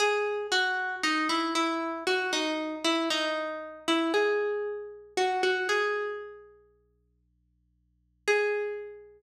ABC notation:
X:1
M:4/4
L:1/16
Q:1/4=58
K:G#m
V:1 name="Pizzicato Strings"
G2 F2 D E E2 F D2 E D3 E | G4 F F G6 z4 | G16 |]